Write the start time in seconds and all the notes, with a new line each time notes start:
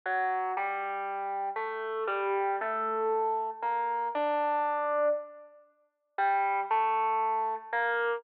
0.06 F#3 F#4
0.57 G3 G4
1.56 A3 A4
2.07 G3 G4
2.61 A3 A4
3.62 A#3 A#4
4.15 D4 D5
6.18 G3 G4
6.71 A3 A4
7.73 A#3 A#4